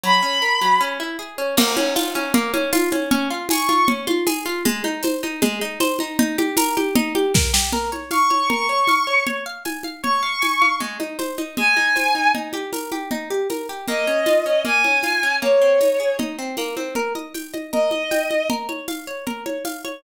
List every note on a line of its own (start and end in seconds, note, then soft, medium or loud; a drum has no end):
0.04 0.21 F#3 medium
0.04 0.80 B5 medium
0.23 0.40 C#4 medium
0.42 0.59 A#4 medium
0.61 0.79 F#3 medium
0.81 0.98 C#4 loud
1.00 1.17 E4 medium
1.19 1.36 G#4 medium
1.38 1.55 C#4 medium
1.57 1.75 A#3 loud
1.57 crash loud
1.57 low conga loud
1.77 1.94 C#4 loud
1.77 high conga loud
1.96 2.13 F4 loud
1.96 tambourine loud
1.96 high conga loud
2.15 2.32 C#4 loud
2.15 high conga medium
2.34 2.52 A#3 loud
2.34 low conga loud
2.54 2.71 C#4 loud
2.54 high conga medium
2.73 2.90 F4 loud
2.73 tambourine loud
2.73 high conga loud
2.92 3.09 C#4 medium
2.92 high conga loud
3.11 3.28 C#4 loud
3.11 low conga loud
3.30 3.48 F4 medium
3.49 3.67 G#4 medium
3.49 3.86 C#6 medium
3.49 tambourine loud
3.49 high conga loud
3.69 3.86 F4 medium
3.69 high conga medium
3.88 4.06 C#4 medium
3.88 low conga loud
4.07 4.25 F4 loud
4.07 high conga loud
4.27 4.44 G#4 loud
4.27 tambourine loud
4.27 high conga loud
4.46 4.63 F4 loud
4.65 4.83 G#3 loud
4.65 low conga loud
4.84 5.02 D#4 medium
4.84 high conga medium
5.03 5.21 C5 medium
5.03 tambourine medium
5.03 high conga loud
5.23 5.40 D#4 medium
5.23 high conga medium
5.42 5.59 G#3 loud
5.42 low conga loud
5.61 5.79 D#4 medium
5.80 5.98 C5 loud
5.80 tambourine medium
5.80 high conga loud
5.99 6.17 D#4 loud
5.99 high conga medium
6.19 6.36 D#4 loud
6.19 low conga loud
6.38 6.56 G4 loud
6.38 high conga loud
6.57 6.75 A#4 loud
6.57 tambourine loud
6.57 high conga loud
6.77 6.94 G4 medium
6.77 high conga loud
6.96 7.13 D#4 loud
6.96 low conga loud
7.15 7.32 G4 loud
7.15 high conga loud
7.34 7.52 A#4 loud
7.34 kick loud
7.34 snare loud
7.54 7.71 G4 loud
7.54 snare loud
7.73 7.90 A#4 medium
7.73 low conga loud
7.92 8.09 C#5 medium
7.92 high conga medium
8.11 8.28 F5 medium
8.11 8.48 C#6 medium
8.11 tambourine medium
8.11 high conga medium
8.30 8.48 C#5 medium
8.30 high conga medium
8.50 8.67 A#4 medium
8.50 9.21 C#6 medium
8.50 low conga loud
8.69 8.86 C#5 medium
8.87 9.06 F5 medium
8.87 tambourine medium
8.87 high conga medium
9.07 9.24 C#5 medium
9.27 9.44 C#5 medium
9.27 low conga medium
9.46 9.63 F5 medium
9.65 9.83 G#5 medium
9.65 tambourine medium
9.65 high conga medium
9.83 10.02 F5 medium
9.83 high conga medium
10.03 10.21 C#5 medium
10.03 10.74 C#6 medium
10.03 low conga medium
10.23 10.40 F5 medium
10.42 10.59 G#5 medium
10.42 tambourine medium
10.42 high conga medium
10.62 10.79 F5 medium
10.62 high conga medium
10.80 10.98 G#3 medium
10.80 low conga medium
11.00 11.17 D#4 medium
11.00 high conga medium
11.19 11.36 C5 medium
11.19 tambourine medium
11.19 high conga medium
11.38 11.55 D#4 medium
11.38 high conga medium
11.57 11.75 G#3 medium
11.57 12.29 G#5 medium
11.57 low conga loud
11.77 11.94 D#4 medium
11.77 high conga medium
11.96 12.13 C5 medium
11.96 tambourine medium
11.96 high conga medium
12.15 12.32 D#4 medium
12.35 12.52 D#4 medium
12.35 low conga medium
12.53 12.71 G4 medium
12.53 high conga medium
12.73 12.90 A#4 medium
12.73 tambourine medium
12.73 high conga medium
12.92 13.09 G4 medium
12.92 high conga medium
13.11 13.29 D#4 medium
13.11 low conga loud
13.30 13.48 G4 medium
13.50 13.67 A#4 medium
13.50 tambourine medium
13.50 high conga medium
13.69 13.87 G4 medium
13.88 14.05 A#3 medium
13.88 14.62 D#5 medium
13.88 low conga medium
14.07 14.25 C#4 medium
14.26 14.44 F4 medium
14.26 tambourine medium
14.26 high conga medium
14.46 14.63 C#4 medium
14.65 14.82 A#3 medium
14.65 15.35 G#5 medium
14.65 low conga medium
14.84 15.02 C#4 medium
14.84 high conga medium
15.03 15.21 F4 medium
15.03 tambourine medium
15.03 high conga medium
15.23 15.40 C#4 medium
15.42 15.59 A#3 medium
15.42 16.13 C#5 medium
15.42 low conga medium
15.62 15.79 C4 medium
15.81 15.98 D#4 medium
15.81 tambourine medium
15.81 high conga medium
16.00 16.17 G#4 medium
16.19 16.36 D#4 medium
16.19 low conga loud
16.39 16.56 C4 medium
16.57 16.75 A#3 medium
16.57 tambourine medium
16.57 high conga medium
16.77 16.94 C4 medium
16.77 high conga medium
16.95 17.13 A#4 medium
16.95 low conga medium
17.15 17.33 D#5 medium
17.15 high conga medium
17.34 17.52 G5 medium
17.34 tambourine medium
17.34 high conga medium
17.54 17.71 D#5 medium
17.54 high conga medium
17.72 17.90 A#4 medium
17.72 18.48 D#5 medium
17.72 low conga medium
17.91 18.09 D#5 medium
17.91 high conga medium
18.11 18.29 G5 medium
18.11 tambourine medium
18.11 high conga medium
18.31 18.48 D#5 medium
18.31 high conga medium
18.50 18.67 A#4 medium
18.50 low conga loud
18.69 18.86 C#5 medium
18.69 high conga medium
18.88 19.05 F5 medium
18.88 tambourine medium
18.88 high conga medium
19.07 19.25 C#5 medium
19.27 19.44 A#4 medium
19.27 low conga medium
19.46 19.63 C#5 medium
19.46 high conga medium
19.65 19.82 F5 medium
19.65 tambourine medium
19.65 high conga medium
19.85 20.02 C#5 medium
19.85 high conga medium